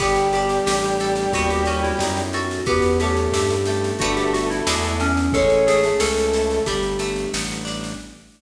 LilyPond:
<<
  \new Staff \with { instrumentName = "Electric Piano 2" } { \time 4/4 \key g \lydian \tempo 4 = 90 g'8 g'8 g'4 fis'16 g'16 fis'16 e'8. fis'8 | g'8 g'8 g'4 fis'16 g'16 fis'16 e'8. cis'8 | a'8 gis'8 a'4 g'4 r4 | }
  \new Staff \with { instrumentName = "Brass Section" } { \time 4/4 \key g \lydian <g g'>1 | <b b'>8 <a a'>4 <a a'>2~ <a a'>8 | <cis' cis''>8. <a a'>4~ <a a'>16 r2 | }
  \new Staff \with { instrumentName = "Acoustic Guitar (steel)" } { \time 4/4 \key g \lydian b8 d'8 g'8 a'8 b8 cis'8 dis'8 a'8 | b8 cis'8 e'8 g'8 <a b d' g'>4 <gis b d' e'>4 | gis8 a8 cis'8 e'8 g8 a8 b8 d'8 | }
  \new Staff \with { instrumentName = "Synth Bass 1" } { \clef bass \time 4/4 \key g \lydian g,,4 a,,4 dis,4 fis,4 | e,4 g,4 g,,4 e,4 | a,,4 cis,4 g,,4 a,,4 | }
  \new Staff \with { instrumentName = "Pad 2 (warm)" } { \time 4/4 \key g \lydian <b d' g' a'>2 <b cis' dis' a'>2 | <b cis' e' g'>2 <a b d' g'>4 <gis b d' e'>4 | <gis a cis' e'>2 <g a b d'>2 | }
  \new DrumStaff \with { instrumentName = "Drums" } \drummode { \time 4/4 <cymc bd sn>16 sn16 sn16 sn16 sn16 sn16 sn16 sn16 <bd sn>16 sn16 sn16 sn16 sn16 sn16 sn16 sn16 | <bd sn>16 sn16 sn16 sn16 sn16 sn16 sn16 sn16 <bd sn>16 sn16 sn16 sn16 sn16 sn16 sn16 sn16 | <bd sn>16 sn16 sn16 sn16 sn16 sn16 sn16 sn16 <bd sn>16 sn16 sn16 sn16 sn16 sn16 sn16 sn16 | }
>>